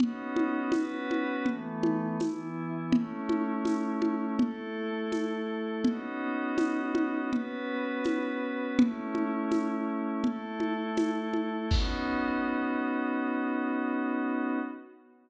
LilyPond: <<
  \new Staff \with { instrumentName = "Pad 5 (bowed)" } { \time 4/4 \key b \mixolydian \tempo 4 = 82 <b cis' dis' fis'>4 <b cis' fis' b'>4 <e a b>4 <e b e'>4 | <a cis' e'>2 <a e' a'>2 | <b cis' dis' fis'>2 <b cis' fis' b'>2 | <a cis' e'>2 <a e' a'>2 |
<b cis' dis' fis'>1 | }
  \new DrumStaff \with { instrumentName = "Drums" } \drummode { \time 4/4 cgl8 cgho8 <cgho tamb>8 cgho8 cgl8 cgho8 <cgho tamb>4 | cgl8 cgho8 <cgho tamb>8 cgho8 cgl4 <cgho tamb>4 | cgl4 <cgho tamb>8 cgho8 cgl4 <cgho tamb>4 | cgl8 cgho8 <cgho tamb>4 cgl8 cgho8 <cgho tamb>8 cgho8 |
<cymc bd>4 r4 r4 r4 | }
>>